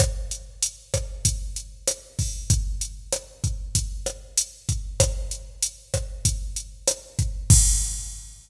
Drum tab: CC |--------|--------|--------|x-------|
HH |xxxxxxxo|xxxxxxxx|xxxxxxxx|--------|
SD |r--r--r-|--r--r--|r--r--r-|--------|
BD |o--oo--o|o--oo--o|o--oo--o|o-------|